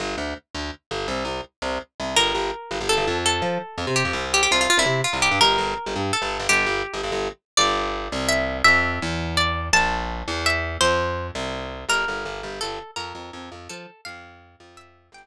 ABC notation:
X:1
M:6/8
L:1/16
Q:3/8=111
K:Gdor
V:1 name="Acoustic Guitar (steel)"
z12 | z12 | B8 A4 | A8 G4 |
G G F F F E3 F2 G2 | B8 A4 | G6 z6 | d8 e4 |
e8 d4 | a8 e4 | c6 z6 | B8 A4 |
B8 A4 | f8 e4 | g4 z8 |]
V:2 name="Electric Bass (finger)" clef=bass
G,,,2 D,,4 D,,4 G,,,2 | C,,2 C,,4 C,,4 C,,2 | G,,,2 G,,,4 G,,, G,,,2 G,,, F,,2- | F,,2 F,4 F,, C,2 F,, C,,2- |
C,,2 C,,3 C,, C,3 C,,2 G,, | G,,,2 G,,,3 G,,, G,,3 G,,,2 G,,, | G,,,2 G,,,3 G,,, G,,, G,,,5 | G,,,6 C,,6 |
F,,4 E,,8 | B,,,6 E,,6 | F,,6 C,,6 | G,,,2 G,,,2 G,,,2 G,,,2 G,,,4 |
F,,2 F,,2 F,,2 F,,2 F,4 | F,,6 F,,6 | G,,,2 z10 |]